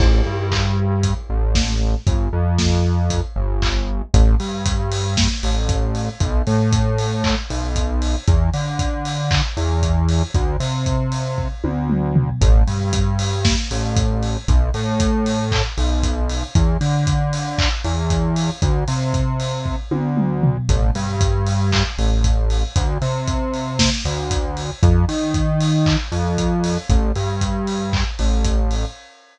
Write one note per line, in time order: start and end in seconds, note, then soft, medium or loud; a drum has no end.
0.00 0.22 A1 loud
0.00 kick loud
0.00 crash loud
0.26 1.14 G2 medium
0.52 kick medium
0.52 clap loud
1.03 kick medium
1.03 closed hi-hat loud
1.30 1.95 A1 medium
1.55 kick medium
1.55 snare loud
2.07 2.29 G1 medium
2.07 kick loud
2.07 closed hi-hat medium
2.33 3.21 F2 medium
2.58 kick medium
2.58 snare loud
3.10 kick medium
3.10 closed hi-hat loud
3.36 4.02 G1 medium
3.62 kick medium
3.62 clap loud
4.14 4.36 A1 loud
4.14 kick loud
4.14 closed hi-hat loud
4.40 5.28 G2 medium
4.40 open hi-hat medium
4.66 kick loud
4.66 closed hi-hat loud
4.91 open hi-hat loud
5.17 kick loud
5.17 snare loud
5.43 6.09 A1 medium
5.43 open hi-hat medium
5.69 kick loud
5.69 closed hi-hat loud
5.95 open hi-hat medium
6.20 6.42 B1 loud
6.20 kick loud
6.20 closed hi-hat loud
6.47 7.35 A2 medium
6.47 open hi-hat medium
6.73 kick loud
6.73 closed hi-hat loud
6.98 open hi-hat medium
7.24 kick medium
7.24 clap loud
7.50 8.16 B1 medium
7.50 open hi-hat medium
7.76 kick medium
7.76 closed hi-hat loud
8.02 open hi-hat medium
8.27 8.50 E2 loud
8.27 kick loud
8.27 closed hi-hat loud
8.53 9.41 D3 medium
8.53 open hi-hat medium
8.79 kick medium
8.79 closed hi-hat loud
9.05 open hi-hat medium
9.31 kick loud
9.31 clap loud
9.57 10.23 E2 medium
9.57 open hi-hat medium
9.83 kick medium
9.83 closed hi-hat loud
10.09 open hi-hat medium
10.34 10.57 D2 loud
10.34 kick loud
10.34 closed hi-hat medium
10.60 11.48 C3 medium
10.60 open hi-hat medium
10.86 kick medium
10.86 closed hi-hat medium
11.12 open hi-hat medium
11.38 kick medium
11.64 12.30 D2 medium
11.64 high tom medium
11.90 mid tom medium
12.16 floor tom loud
12.41 12.63 A1 loud
12.41 kick loud
12.41 closed hi-hat loud
12.67 13.55 G2 medium
12.67 open hi-hat medium
12.93 kick loud
12.93 closed hi-hat loud
13.19 open hi-hat loud
13.45 kick loud
13.45 snare loud
13.71 14.37 A1 medium
13.71 open hi-hat medium
13.97 kick loud
13.97 closed hi-hat loud
14.23 open hi-hat medium
14.48 14.70 B1 loud
14.48 kick loud
14.48 closed hi-hat loud
14.74 15.62 A2 loud
14.74 open hi-hat medium
15.00 kick loud
15.00 closed hi-hat loud
15.26 open hi-hat medium
15.52 kick medium
15.52 clap loud
15.78 16.44 B1 medium
15.78 open hi-hat medium
16.03 kick medium
16.03 closed hi-hat loud
16.29 open hi-hat medium
16.55 16.77 E2 loud
16.55 kick loud
16.55 closed hi-hat loud
16.81 17.69 D3 medium
16.81 open hi-hat medium
17.07 kick medium
17.07 closed hi-hat loud
17.33 open hi-hat medium
17.58 kick loud
17.58 clap loud
17.84 18.50 E2 loud
17.84 open hi-hat medium
18.10 kick medium
18.10 closed hi-hat loud
18.36 open hi-hat medium
18.62 18.84 D2 loud
18.62 kick loud
18.62 closed hi-hat loud
18.88 19.76 C3 medium
18.88 open hi-hat medium
19.14 kick medium
19.14 closed hi-hat medium
19.40 open hi-hat medium
19.66 kick medium
19.91 20.57 D2 medium
19.91 high tom medium
20.17 mid tom medium
20.43 floor tom loud
20.69 20.91 A1 loud
20.69 kick loud
20.69 closed hi-hat loud
20.95 21.83 G2 loud
20.95 open hi-hat medium
21.21 kick loud
21.21 closed hi-hat loud
21.47 open hi-hat medium
21.72 kick medium
21.72 clap loud
21.98 22.64 A1 medium
21.98 open hi-hat medium
22.24 kick medium
22.24 closed hi-hat loud
22.50 open hi-hat medium
22.76 22.98 D2 loud
22.76 kick loud
22.76 closed hi-hat loud
23.02 23.90 C3 loud
23.02 open hi-hat medium
23.27 kick medium
23.27 closed hi-hat loud
23.54 open hi-hat medium
23.79 kick medium
23.79 snare loud
24.05 24.71 D2 loud
24.05 open hi-hat medium
24.31 kick medium
24.31 closed hi-hat loud
24.57 open hi-hat medium
24.83 25.05 F2 loud
24.83 kick loud
24.83 closed hi-hat loud
25.09 25.96 D#3 medium
25.09 open hi-hat medium
25.34 kick medium
25.34 closed hi-hat loud
25.60 open hi-hat loud
25.86 kick medium
25.86 clap loud
26.12 26.78 F2 medium
26.12 open hi-hat medium
26.38 kick medium
26.38 closed hi-hat loud
26.64 open hi-hat medium
26.89 27.12 A1 loud
26.89 kick loud
26.89 closed hi-hat loud
27.15 28.04 G2 medium
27.15 open hi-hat medium
27.41 kick medium
27.41 closed hi-hat loud
27.67 open hi-hat medium
27.93 kick medium
27.93 clap loud
28.19 28.85 A1 medium
28.19 open hi-hat medium
28.45 kick medium
28.45 closed hi-hat loud
28.71 open hi-hat medium